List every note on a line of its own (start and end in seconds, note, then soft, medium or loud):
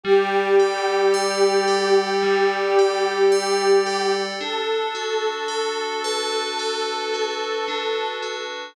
0.04 2.22 G3 medium
0.04 4.03 G4 medium
0.60 1.67 A4 medium
1.14 3.31 D5 medium
1.68 2.78 A4 medium
2.23 4.30 G3 medium
2.79 3.86 A4 medium
3.32 4.35 D5 medium
3.86 4.38 A4 medium
4.41 7.68 D4 medium
4.41 8.08 A4 medium
4.95 7.13 F#4 medium
5.48 6.59 A4 medium
6.04 8.63 B4 medium
6.59 8.66 A4 medium
7.14 8.22 F#4 medium
7.68 8.72 D4 medium
8.22 8.74 F#4 medium